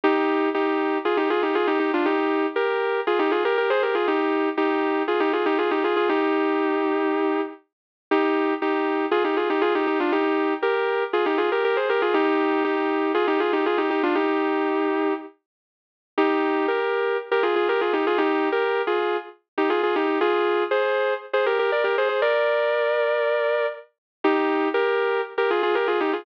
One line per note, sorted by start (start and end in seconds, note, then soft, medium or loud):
0.03 0.49 D#4 loud
0.03 0.49 G4 loud
0.54 0.98 D#4 medium
0.54 0.98 G4 medium
1.05 1.17 F4 medium
1.05 1.17 G#4 medium
1.17 1.29 D#4 medium
1.17 1.29 G4 medium
1.30 1.42 F4 medium
1.30 1.42 G#4 medium
1.42 1.54 D#4 medium
1.42 1.54 G4 medium
1.55 1.67 F4 medium
1.55 1.67 G#4 medium
1.67 1.79 D#4 medium
1.67 1.79 G4 loud
1.79 1.91 D#4 medium
1.79 1.91 G4 medium
1.93 2.05 D4 medium
1.93 2.05 F4 medium
2.05 2.46 D#4 medium
2.05 2.46 G4 loud
2.56 3.00 G4 medium
2.56 3.00 A#4 medium
3.07 3.19 F4 medium
3.07 3.19 G#4 medium
3.19 3.31 D#4 medium
3.19 3.31 G4 loud
3.31 3.43 F4 medium
3.31 3.43 G#4 medium
3.45 3.57 G4 medium
3.45 3.57 A#4 loud
3.58 3.70 G4 medium
3.58 3.70 A#4 medium
3.70 3.82 G#4 loud
3.70 3.82 C5 loud
3.82 3.94 G4 medium
3.82 3.94 A#4 medium
3.95 4.07 F4 medium
3.95 4.07 G#4 medium
4.07 4.49 D#4 medium
4.07 4.49 G4 loud
4.57 5.03 D#4 medium
4.57 5.03 G4 loud
5.07 5.19 F4 medium
5.07 5.19 G#4 medium
5.20 5.32 D#4 medium
5.20 5.32 G4 loud
5.33 5.45 F4 medium
5.33 5.45 G#4 medium
5.46 5.58 D#4 medium
5.46 5.58 G4 loud
5.58 5.70 F4 medium
5.58 5.70 G#4 medium
5.71 5.83 D#4 medium
5.71 5.83 G4 medium
5.84 5.96 F4 medium
5.84 5.96 G#4 medium
5.96 6.08 F4 medium
5.96 6.08 G#4 medium
6.09 7.41 D#4 medium
6.09 7.41 G4 loud
8.11 8.54 D#4 medium
8.11 8.54 G4 loud
8.62 9.06 D#4 medium
8.62 9.06 G4 medium
9.11 9.23 F4 medium
9.11 9.23 G#4 loud
9.24 9.36 D#4 medium
9.24 9.36 G4 medium
9.37 9.49 F4 medium
9.37 9.49 G#4 medium
9.50 9.62 D#4 medium
9.50 9.62 G4 medium
9.61 9.73 F4 medium
9.61 9.73 G#4 loud
9.75 9.86 D#4 medium
9.75 9.86 G4 medium
9.87 9.99 D#4 medium
9.87 9.99 G4 medium
10.00 10.12 D4 medium
10.00 10.12 F4 medium
10.12 10.54 D#4 medium
10.12 10.54 G4 loud
10.62 11.04 G4 medium
10.62 11.04 A#4 medium
11.13 11.25 F4 medium
11.13 11.25 G#4 medium
11.26 11.38 D#4 medium
11.26 11.38 G4 medium
11.38 11.50 F4 medium
11.38 11.50 G#4 medium
11.52 11.64 G4 medium
11.52 11.64 A#4 medium
11.64 11.76 G4 medium
11.64 11.76 A#4 loud
11.76 11.88 G#4 medium
11.76 11.88 C5 medium
11.89 12.01 G4 medium
11.89 12.01 A#4 loud
12.02 12.14 F4 medium
12.02 12.14 G#4 loud
12.14 12.63 D#4 loud
12.14 12.63 G4 loud
12.64 13.12 D#4 medium
12.64 13.12 G4 medium
13.14 13.26 F4 medium
13.14 13.26 G#4 loud
13.27 13.39 D#4 medium
13.27 13.39 G4 loud
13.40 13.52 F4 medium
13.40 13.52 G#4 medium
13.53 13.65 D#4 medium
13.53 13.65 G4 medium
13.66 13.78 F4 medium
13.66 13.78 G#4 medium
13.78 13.89 D#4 medium
13.78 13.89 G4 medium
13.90 14.02 D#4 medium
13.90 14.02 G4 medium
14.03 14.15 D4 medium
14.03 14.15 F4 loud
14.15 15.14 D#4 medium
14.15 15.14 G4 loud
16.17 16.66 D#4 medium
16.17 16.66 G4 loud
16.68 17.17 G4 medium
16.68 17.17 A#4 medium
17.31 17.43 G4 medium
17.31 17.43 A#4 medium
17.43 17.55 F4 medium
17.43 17.55 G#4 medium
17.56 17.68 F4 medium
17.56 17.68 G#4 medium
17.68 17.80 G4 medium
17.68 17.80 A#4 loud
17.81 17.93 F4 medium
17.81 17.93 G#4 medium
17.93 18.05 D#4 medium
17.93 18.05 G4 medium
18.07 18.19 F4 medium
18.07 18.19 G#4 loud
18.18 18.49 D#4 loud
18.18 18.49 G4 loud
18.52 18.82 G4 medium
18.52 18.82 A#4 loud
18.87 19.17 F4 medium
18.87 19.17 G#4 medium
19.57 19.69 D#4 medium
19.57 19.69 G4 medium
19.70 19.82 F4 medium
19.70 19.82 G#4 medium
19.83 19.95 F4 medium
19.83 19.95 G#4 medium
19.96 20.19 D#4 medium
19.96 20.19 G4 medium
20.21 20.63 F4 loud
20.21 20.63 G#4 loud
20.71 21.14 G#4 medium
20.71 21.14 C5 loud
21.33 21.45 G#4 medium
21.33 21.45 C5 medium
21.46 21.58 G4 medium
21.46 21.58 A#4 medium
21.59 21.71 G4 medium
21.59 21.71 A#4 medium
21.72 21.83 A#4 medium
21.72 21.84 D5 medium
21.84 21.96 G4 medium
21.84 21.96 A#4 loud
21.98 22.08 G#4 medium
21.98 22.08 C5 loud
22.09 22.21 G#4 medium
22.09 22.21 C5 medium
22.22 23.66 A#4 loud
22.22 23.66 D5 loud
24.24 24.68 D#4 loud
24.24 24.68 G4 loud
24.74 25.21 G4 medium
24.74 25.21 A#4 loud
25.38 25.49 G4 medium
25.38 25.49 A#4 medium
25.50 25.62 F4 medium
25.50 25.62 G#4 medium
25.63 25.75 F4 medium
25.63 25.75 G#4 loud
25.75 25.87 G4 medium
25.75 25.87 A#4 medium
25.87 25.99 F4 medium
25.87 25.99 G#4 medium
26.00 26.12 D#4 medium
26.00 26.12 G4 medium
26.13 26.25 F4 medium
26.13 26.25 G#4 medium